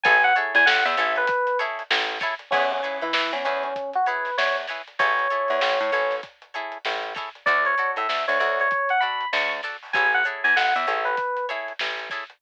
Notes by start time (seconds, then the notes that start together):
0.03 A1 E4 G#4 A4 C#5 G#5, kick, closed hi-hat
0.23 F#5, closed hi-hat
0.35 E4 G#4 A4 C#5, closed hi-hat
0.55 E2 G#5, closed hi-hat
0.66 A1 F#5, snare
0.85 E2 E5, closed hi-hat
0.97 A1 E4 G#4 A4 C#5, closed hi-hat
1.15 B4, closed hi-hat
1.27 kick, closed hi-hat
1.47 closed hi-hat
1.59 E4 G#4 A4 C#5, snare, closed hi-hat
1.79 closed hi-hat
1.90 A1, snare
2.09 snare, closed hi-hat
2.20 E4 G#4 A4 C#5, kick, snare, closed hi-hat
2.39 closed hi-hat
2.51 E2 C#4 E4 G#4 B4 C#5, kick, crash
2.71 C#4, closed hi-hat
2.83 E4 G#4 B4 C#5, closed hi-hat
3.01 E3 E4, closed hi-hat
3.13 E3, snare
3.33 E2 C#4, closed hi-hat
3.45 E2 C#4 E4 G#4 B4 C#5, snare, closed hi-hat
3.63 C#4, closed hi-hat
3.76 kick, closed hi-hat
3.93 F#4, closed hi-hat
4.06 E4 G#4 B4 C#5, closed hi-hat
4.25 snare, closed hi-hat
4.38 E2 C#5, snare
4.57 snare, closed hi-hat
4.67 E4 G#4 B4 C#5, snare, closed hi-hat
4.88 closed hi-hat
4.99 A1 E4 G#4 A4 C#5, kick, closed hi-hat
5.19 closed hi-hat
5.30 E4 G#4 A4 C#5, closed hi-hat
5.48 E2, closed hi-hat
5.61 A1, snare
5.80 A2, closed hi-hat
5.92 A1 E4 G#4 A4 C#5, closed hi-hat
6.11 snare, closed hi-hat
6.23 kick, closed hi-hat
6.42 closed hi-hat
6.54 E4 G#4 A4 C#5, closed hi-hat
6.72 closed hi-hat
6.85 A1, snare
7.03 closed hi-hat
7.14 E4 G#4 A4 C#5, kick, snare, closed hi-hat
7.35 closed hi-hat
7.46 D2 F#4 A4 D5, kick, closed hi-hat
7.65 C#5, closed hi-hat
7.78 F#4 A4 D5, closed hi-hat
7.96 A2 E5, closed hi-hat
8.09 D2, snare
8.28 D2 C#5, closed hi-hat
8.40 D2 F#4 A4 C#5 D5, closed hi-hat
8.60 C#5, closed hi-hat
8.71 kick, closed hi-hat
8.89 F#5, closed hi-hat
9.00 F#4 A4 D5 B5, closed hi-hat
9.20 closed hi-hat
9.32 D2 C#6, snare
9.50 snare, closed hi-hat
9.63 F#4 A4 D5, snare, closed hi-hat
9.83 open hi-hat
9.93 A1 E4 G#4 A4 C#5 G#5, kick, closed hi-hat
10.13 F#5, closed hi-hat
10.24 E4 G#4 A4 C#5, closed hi-hat
10.44 E2 G#5, closed hi-hat
10.56 A1 F#5, snare
10.75 E2 E5, closed hi-hat
10.87 A1 E4 G#4 A4 C#5, closed hi-hat
11.05 B4, closed hi-hat
11.17 kick, closed hi-hat
11.36 closed hi-hat
11.49 E4 G#4 A4 C#5, snare, closed hi-hat
11.68 closed hi-hat
11.79 A1, snare
11.99 snare, closed hi-hat
12.10 E4 G#4 A4 C#5, kick, snare, closed hi-hat
12.30 closed hi-hat